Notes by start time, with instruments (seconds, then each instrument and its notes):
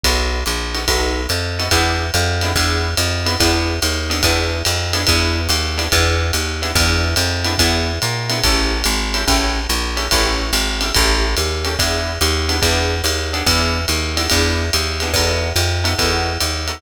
0.03 electric bass (finger) B1, acoustic guitar (steel) B3 D#4 F#4 A4, kick, ride
0.46 electric bass (finger) A#1, hi-hat pedal, ride
0.74 acoustic guitar (steel) B3 D#4 F#4 A4, ride
0.87 electric bass (finger) B1, acoustic guitar (steel) B3 D#4 F#4 A4, kick, ride
1.29 electric bass (finger) F2, hi-hat pedal, ride
1.59 acoustic guitar (steel) B3 D#4 F#4 A4, ride
1.71 electric bass (finger) E2, acoustic guitar (steel) B3 D4 E4 G#4, kick, ride
2.14 electric bass (finger) F2, hi-hat pedal, ride
2.41 acoustic guitar (steel) B3 D4 E4 G#4, ride
2.56 electric bass (finger) E2, acoustic guitar (steel) B3 D4 E4 G#4, kick, ride
2.97 electric bass (finger) F2, hi-hat pedal, ride
3.26 acoustic guitar (steel) B3 D4 E4 G#4, ride
3.40 electric bass (finger) E2, acoustic guitar (steel) B3 D4 E4 G#4, kick, ride
3.82 electric bass (finger) D#2, hi-hat pedal, ride
4.10 acoustic guitar (steel) B3 D4 E4 G#4, ride
4.23 electric bass (finger) E2, acoustic guitar (steel) B3 D4 E4 G#4, kick, ride
4.65 electric bass (finger) F2, hi-hat pedal, ride
4.93 acoustic guitar (steel) B3 D4 E4 G#4, ride
5.07 electric bass (finger) E2, acoustic guitar (steel) B3 D4 E4 G#4, kick, ride
5.49 electric bass (finger) D#2, hi-hat pedal, ride
5.78 acoustic guitar (steel) B3 D4 E4 G#4, ride
5.92 electric bass (finger) E2, acoustic guitar (steel) B3 D4 E4 G#4, kick, ride
6.33 electric bass (finger) D#2, hi-hat pedal, ride
6.62 acoustic guitar (steel) B3 D4 E4 G#4, ride
6.75 electric bass (finger) E2, acoustic guitar (steel) B3 D4 E4 G#4, kick, ride
7.16 electric bass (finger) F2, hi-hat pedal, ride
7.44 acoustic guitar (steel) B3 D4 E4 G#4, ride
7.58 electric bass (finger) E2, acoustic guitar (steel) B3 D4 E4 G#4, kick, ride
8.02 electric bass (finger) A#2, hi-hat pedal, ride
8.30 acoustic guitar (steel) B3 D4 E4 G#4, ride
8.44 electric bass (finger) A1, acoustic guitar (steel) C#4 E4 G4 A4, kick, ride
8.84 electric bass (finger) G#1, hi-hat pedal, ride
9.14 acoustic guitar (steel) C#4 E4 G4 A4, ride
9.27 electric bass (finger) A1, acoustic guitar (steel) C#4 E4 G4 A4, kick, ride
9.69 electric bass (finger) A#1, hi-hat pedal, ride
9.97 acoustic guitar (steel) C#4 E4 G4 A4, ride
10.11 electric bass (finger) A1, acoustic guitar (steel) C#4 E4 G4 A4, kick, ride
10.53 electric bass (finger) G#1, hi-hat pedal, ride
10.81 acoustic guitar (steel) C#4 E4 G4 A4, ride
10.94 electric bass (finger) A1, acoustic guitar (steel) C#4 E4 G4 A4, kick, ride
11.37 electric bass (finger) D#2, hi-hat pedal, ride
11.65 acoustic guitar (steel) C#4 E4 G4 A4, ride
11.79 electric bass (finger) E2, acoustic guitar (steel) B3 D4 E4 G#4, kick, ride
12.21 electric bass (finger) D#2, hi-hat pedal, ride
12.49 acoustic guitar (steel) B3 D4 E4 G#4, ride
12.62 electric bass (finger) E2, acoustic guitar (steel) B3 D4 E4 G#4, kick, ride
13.04 electric bass (finger) D#2, hi-hat pedal, ride
13.33 acoustic guitar (steel) B3 D4 E4 G#4, ride
13.46 electric bass (finger) E2, acoustic guitar (steel) B3 D4 E4 G#4, kick, ride
13.88 electric bass (finger) D#2, hi-hat pedal, ride
14.17 acoustic guitar (steel) B3 D4 E4 G#4, ride
14.30 electric bass (finger) E2, acoustic guitar (steel) B3 D4 E4 G#4, kick, ride
14.73 electric bass (finger) D#2, hi-hat pedal, ride
15.00 acoustic guitar (steel) B3 D4 E4 G#4, ride
15.14 electric bass (finger) E2, acoustic guitar (steel) B3 D#4 F#4 A4, kick, ride
15.56 electric bass (finger) F2, hi-hat pedal, ride
15.84 acoustic guitar (steel) B3 D#4 F#4 A4, ride
15.98 electric bass (finger) E2, acoustic guitar (steel) B3 D#4 F#4 A4, kick, ride
16.40 electric bass (finger) D#2, hi-hat pedal, ride
16.68 acoustic guitar (steel) B3 D#4 F#4 A4, ride